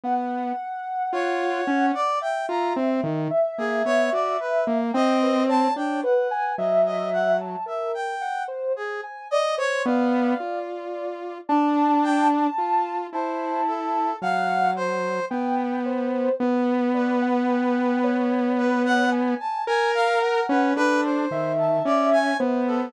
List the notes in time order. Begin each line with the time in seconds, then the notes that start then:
0.03 B3 F#5
1.12 F4 C#5
1.67 C#4
1.94 D5
2.21 E5 G5
2.49 F4 A#5
2.76 C4
3.03 D#3
3.30 E5
3.58 A#3 G#4
3.85 B3 C#5
4.12 F#4 D5
4.40 B4
4.67 A#3
4.94 C4 D#5 G5
5.22 B4
5.48 C#5 A5
5.76 D4 C#5 G5
6.03 B4 F#5
6.31 G#5
6.58 F#3 D#5 E5
6.85 D#5
7.12 F#5
7.40 A5
7.66 A#4 E5
7.94 G5
8.21 F#5
8.48 C5
8.76 G#4
9.03 G#5
9.31 D5 D#5
9.57 C5 C#5
9.85 B3 D5 F5
10.40 F4
11.49 D4 A5
12.03 G5
12.58 F4
13.12 E4 C5 A5
13.67 A4
14.22 F#3 F5 F#5
14.76 C5
15.30 B3 G5
15.85 C5
16.40 B3 B4
16.94 B4 D5
17.22 F#5
17.49 G5
18.03 C#5
18.58 B4 C#5
18.85 F#5
19.12 G#5
19.40 A5
19.67 A#4 G#5
19.94 F5
20.22 A#4 F#5
20.49 C#4 B4
20.76 D4 A4 B4
21.03 C5
21.31 D#3 E5
21.58 A5
21.85 C#4 D5
22.12 G#5
22.39 B3 C5
22.67 A4